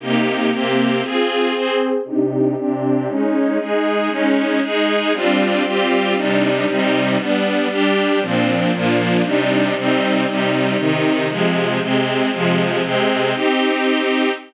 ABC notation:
X:1
M:6/8
L:1/8
Q:3/8=117
K:Cm
V:1 name="String Ensemble 1"
[C,B,EG]3 [C,B,CG]3 | [CFA]3 [CAc]3 | [C,DEG]3 [C,CDG]3 | [A,_DE]3 [A,EA]3 |
[A,_DE]3 [A,EA]3 | [G,CDF]3 [G,CFG]3 | [C,G,DE]3 [C,G,CE]3 | [G,=B,D]3 [G,DG]3 |
[B,,F,CD]3 [B,,F,B,D]3 | [C,G,DE]3 [C,G,CE]3 | [C,G,E]3 [C,E,E]3 | [C,F,A,]3 [C,A,C]3 |
[C,F,A,]3 [C,A,C]3 | [CEG]6 |]